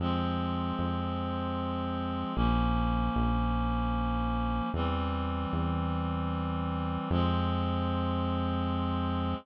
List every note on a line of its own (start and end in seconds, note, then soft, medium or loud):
0.00 0.73 F2 medium
0.00 2.34 F3 loud
0.00 2.34 G#3 loud
0.00 2.34 C4 loud
0.79 2.24 F2 medium
2.35 3.10 A#1 medium
2.35 4.70 F3 medium
2.35 4.70 A#3 medium
2.35 4.70 C#4 medium
3.16 4.61 A#1 medium
4.74 5.46 E2 medium
4.74 7.09 E3 medium
4.74 7.09 G3 medium
4.74 7.09 C4 medium
5.53 6.98 E2 medium
7.11 9.34 F2 loud
7.11 9.35 F3 loud
7.11 9.35 G#3 loud
7.11 9.35 C4 loud